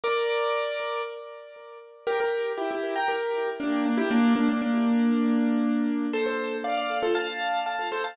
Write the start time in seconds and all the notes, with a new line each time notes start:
0.04 A#4 D5
2.07 G4 A#4
2.20 G4 A#4
2.58 E4 G4
2.71 E4 G4
2.96 G5 A#5
3.08 G4 A#4
3.60 A#3 D4
3.85 A#3 D4
3.97 E4 G4
4.10 A#3 D4
4.36 A#3 D4
4.49 A#3 D4
4.62 A#3 D4
6.13 A4 C5
6.26 A4 C5
6.64 D5 F5
6.77 D5 F5
7.03 F4 A4
7.15 F5 A5
7.66 F5 A5
7.92 A4 C5
8.04 F5 A5